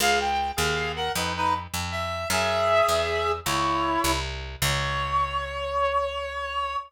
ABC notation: X:1
M:12/8
L:1/8
Q:3/8=104
K:Db
V:1 name="Clarinet"
[Af] =g2 [Af]2 [B_g] [E_c] [Ec] z2 =e2 | [A_f]6 [_Fd]4 z2 | d12 |]
V:2 name="Electric Bass (finger)" clef=bass
D,,3 E,,3 F,,3 F,,3 | G,,3 _F,,3 D,,3 C,,3 | D,,12 |]